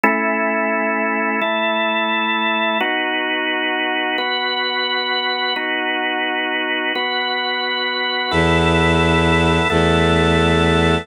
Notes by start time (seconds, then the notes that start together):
0.04 A3 C#4 E4
1.42 A3 E4 A4
2.80 B3 D#4 F#4
4.18 B3 F#4 B4
5.56 B3 D#4 F#4
6.95 B3 F#4 B4
8.31 E2 B3 E4 A4
9.70 E2 A3 B3 A4